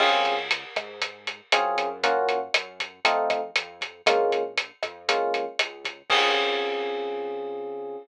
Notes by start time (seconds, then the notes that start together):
0.00 C#2 C4 C#4 F4 G#4, kick, cross-stick, crash
0.25 closed hi-hat
0.51 closed hi-hat
0.76 G#2, kick, cross-stick, closed hi-hat
1.02 kick, closed hi-hat
1.27 closed hi-hat
1.52 F#2 C4 C#4 F4 G#4, cross-stick, closed hi-hat
1.78 F#2, kick, closed hi-hat
2.03 A#3 C#4 F4 F#4, kick, closed hi-hat
2.29 kick, closed hi-hat
2.54 F#2, cross-stick, closed hi-hat
2.80 kick, closed hi-hat
3.05 F2 A3 C4 D#4 F4, closed hi-hat
3.30 kick, cross-stick, closed hi-hat
3.56 F2, closed hi-hat
3.81 kick, closed hi-hat
4.06 A#1 G#3 A#3 C#4 F4, kick, cross-stick, closed hi-hat
4.32 closed hi-hat
4.58 closed hi-hat
4.83 F2, kick, cross-stick, closed hi-hat
5.08 G#3 A#3 C#4 F4, kick, closed hi-hat
5.34 closed hi-hat
5.59 C#2, cross-stick, closed hi-hat
5.85 kick, closed hi-hat
6.10 C#2 C4 C#4 F4 G#4, kick, crash